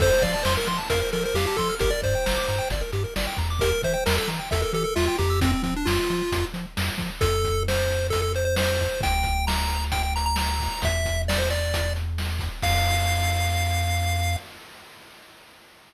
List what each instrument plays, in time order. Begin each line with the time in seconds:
0.00 synth bass 1 F2, lead 1 (square) A4 C5, kick, crash
0.11 lead 1 (square) C5
0.22 synth bass 1 F3, lead 1 (square) D5 F5, kick, closed hi-hat
0.33 lead 1 (square) D5 A5
0.43 synth bass 1 F2, lead 1 (square) C5 C6, snare
0.56 lead 1 (square) A#4 F6
0.67 synth bass 1 F3, lead 1 (square) C6, closed hi-hat
0.78 lead 1 (square) A5
0.90 synth bass 1 F2, lead 1 (square) A#4 F5, kick, closed hi-hat
1.00 lead 1 (square) A#4 C5
1.12 synth bass 1 F3, lead 1 (square) A4 A#4, closed hi-hat
1.23 lead 1 (square) A#4 C5
1.34 synth bass 1 F2, lead 1 (square) G4 F5, snare
1.46 lead 1 (square) G4 A5
1.57 synth bass 1 F3, lead 1 (square) A4 C6, kick, closed hi-hat
1.69 lead 1 (square) F6
1.79 synth bass 1 G1, lead 1 (square) G4 A#4, kick, closed hi-hat
1.90 lead 1 (square) A#4 D5
2.02 synth bass 1 G2, lead 1 (square) C5 D5, kick, closed hi-hat
2.15 lead 1 (square) G5
2.26 synth bass 1 G1, lead 1 (square) A#5, snare
2.36 lead 1 (square) D6
2.48 synth bass 1 G2, lead 1 (square) A#5, closed hi-hat
2.59 lead 1 (square) G5
2.70 synth bass 1 G1, lead 1 (square) D5, kick, closed hi-hat
2.81 lead 1 (square) A#4
2.92 synth bass 1 G2, lead 1 (square) G4, closed hi-hat
3.04 lead 1 (square) A#4
3.16 synth bass 1 G1, lead 1 (square) D5, snare
3.27 lead 1 (square) G5
3.37 synth bass 1 E2, lead 1 (square) A#5, kick, closed hi-hat
3.50 lead 1 (square) D6
3.59 lead 1 (square) G4 A#4, kick, closed hi-hat
3.72 lead 1 (square) A#4
3.82 synth bass 1 E3, lead 1 (square) C5 E5, kick, closed hi-hat
3.93 lead 1 (square) C5 G5
4.06 synth bass 1 E2, lead 1 (square) A#4 A#5, snare
4.17 lead 1 (square) A4 E6
4.28 synth bass 1 E3, lead 1 (square) A#5, closed hi-hat
4.39 lead 1 (square) G5
4.51 synth bass 1 E2, lead 1 (square) A4 E5, kick, closed hi-hat
4.62 lead 1 (square) A4 A#4
4.73 synth bass 1 E3, lead 1 (square) G4 A4, closed hi-hat
4.84 lead 1 (square) A4 A#4
4.96 synth bass 1 E2, lead 1 (square) F4 E5, snare
5.06 lead 1 (square) F4 G5
5.19 synth bass 1 F2, lead 1 (square) G4 A#5, kick, closed hi-hat
5.30 lead 1 (square) E6
5.41 lead 1 (square) C4, kick, closed hi-hat
5.52 lead 1 (square) C4
5.63 synth bass 1 F3, lead 1 (square) C4, kick, closed hi-hat
5.76 lead 1 (square) D4
5.85 synth bass 1 F2, lead 1 (square) F4, snare
6.10 synth bass 1 F3, closed hi-hat
6.32 synth bass 1 F2, kick, closed hi-hat
6.54 synth bass 1 F3, closed hi-hat
6.77 synth bass 1 F2, snare
6.98 synth bass 1 F3, kick, closed hi-hat
7.21 synth bass 1 F2, lead 1 (square) A4, kick, closed hi-hat
7.44 kick, closed hi-hat
7.68 lead 1 (square) C5, snare
7.90 closed hi-hat
8.10 lead 1 (square) A4, kick, closed hi-hat
8.22 lead 1 (square) A4
8.34 lead 1 (square) C5, closed hi-hat
8.45 lead 1 (square) C5
8.56 lead 1 (square) C5, snare
8.80 kick, closed hi-hat
9.01 synth bass 1 D2, lead 1 (square) G5, kick, closed hi-hat
9.23 kick, closed hi-hat
9.47 lead 1 (square) A#5, snare
9.70 closed hi-hat
9.92 lead 1 (square) G5, kick, closed hi-hat
10.03 lead 1 (square) G5
10.16 lead 1 (square) A#5, closed hi-hat
10.26 lead 1 (square) A#5
10.36 lead 1 (square) A#5, snare
10.60 kick, open hi-hat
10.82 synth bass 1 E2, lead 1 (square) E5, kick, closed hi-hat
11.05 kick, closed hi-hat
11.28 lead 1 (square) D5, snare
11.38 lead 1 (square) C5
11.50 lead 1 (square) D5, closed hi-hat
11.74 kick, closed hi-hat
11.96 closed hi-hat
12.18 snare
12.39 kick, closed hi-hat
12.62 synth bass 1 F2, lead 1 (square) F5, kick, crash